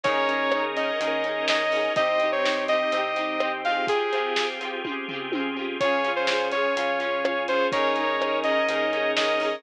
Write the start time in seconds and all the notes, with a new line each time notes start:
0.04 D#2 C#4 D#4 G#4 A#4 C#5, kick, closed hi-hat
0.09 G#4 A#4
0.28 C#4 D#4, closed hi-hat
0.33 G#4 A#4
0.52 C#4 D#4, cross-stick
0.57 G#4 A#4
0.76 C#4 D#4 D#5, closed hi-hat
0.81 G#4 A#4
1.00 D#2 C#4 D#4 G#4 A#4, closed hi-hat
1.05 G#4 A#4
1.24 C#4 D#4, closed hi-hat
1.29 G#4 A#4
1.48 C#4 D#4 D#5, snare
1.53 G#4 A#4
1.72 C#4 D#4, open hi-hat
1.77 G#4 A#4
1.96 C2 C4 D#4 G4 D#5, kick, closed hi-hat
2.01 G4
2.20 C4 D#4, closed hi-hat
2.25 G4
2.32 C#5
2.44 C4 D#4, snare
2.49 G4
2.68 C4 D#4 D#5, closed hi-hat
2.73 G4
2.91 C2 C4 D#4 G4, closed hi-hat
2.97 G4
3.16 C4 D#4, closed hi-hat
3.21 G4
3.40 C4 D#4, cross-stick
3.45 G4
3.65 C4 F4 F5, closed hi-hat
3.69 G4 G#4
3.87 C4 F4 G4 G#4, kick, closed hi-hat
4.12 C4 F4, closed hi-hat
4.17 G4 G#4
4.36 C4 F4, snare
4.41 G4 G#4
4.60 C4 F4, closed hi-hat
4.65 G4 G#4
4.84 C4 F4, kick, high tom
4.89 G4 G#4
5.08 C4 F4, floor tom
5.13 G4 G#4
5.32 C4 F4, high tom
5.37 G4 G#4
5.56 C4 F4
5.61 G4 G#4
5.80 C#2 C#4 F4 G#4 C#5, kick, closed hi-hat
5.85 G#4
6.04 C#4 F4, closed hi-hat
6.09 G#4
6.16 C5
6.27 C#4 F4, snare
6.33 G#4
6.52 C#4 F4 C#5, closed hi-hat
6.57 G#4
6.76 C#2 C#4 F4 G#4, closed hi-hat
6.81 G#4
7.00 C#4 F4, closed hi-hat
7.05 G#4
7.24 C#4 F4, cross-stick
7.29 G#4
7.48 C#4 F4 C5, closed hi-hat
7.53 G#4
7.72 D#2 C#4 D#4 G#4 A#4 C#5, kick, closed hi-hat
7.77 G#4 A#4
7.96 C#4 D#4, closed hi-hat
8.01 G#4 A#4
8.20 C#4 D#4, cross-stick
8.25 G#4 A#4
8.44 C#4 D#4 D#5, closed hi-hat
8.49 G#4 A#4
8.68 D#2 C#4 D#4 G#4 A#4, closed hi-hat
8.73 G#4 A#4
8.92 C#4 D#4, closed hi-hat
8.97 G#4 A#4
9.16 C#4 D#4 D#5, snare
9.21 G#4 A#4
9.40 C#4 D#4, open hi-hat
9.45 G#4 A#4